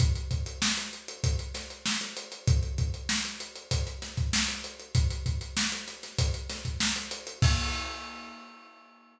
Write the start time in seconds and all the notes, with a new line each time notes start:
0.00 kick, closed hi-hat
0.15 closed hi-hat
0.31 kick, closed hi-hat
0.46 closed hi-hat
0.62 snare
0.77 snare, closed hi-hat
0.93 closed hi-hat
1.08 closed hi-hat
1.24 kick, closed hi-hat
1.39 closed hi-hat
1.54 snare, closed hi-hat
1.70 closed hi-hat
1.86 snare
2.01 snare, closed hi-hat
2.17 closed hi-hat
2.32 closed hi-hat
2.48 kick, closed hi-hat
2.63 closed hi-hat
2.78 kick, closed hi-hat
2.94 closed hi-hat
3.09 snare
3.25 closed hi-hat
3.40 closed hi-hat
3.56 closed hi-hat
3.71 kick, closed hi-hat
3.87 closed hi-hat
4.02 snare, closed hi-hat
4.17 kick, closed hi-hat
4.33 snare
4.48 closed hi-hat
4.64 closed hi-hat
4.80 closed hi-hat
4.95 kick, closed hi-hat
5.10 closed hi-hat
5.26 kick, closed hi-hat
5.41 closed hi-hat
5.57 snare
5.72 snare, closed hi-hat
5.88 snare, closed hi-hat
6.03 snare, closed hi-hat
6.19 kick, closed hi-hat
6.34 closed hi-hat
6.49 snare, closed hi-hat
6.65 kick, closed hi-hat
6.80 snare
6.96 closed hi-hat
7.11 closed hi-hat
7.27 closed hi-hat
7.42 kick, crash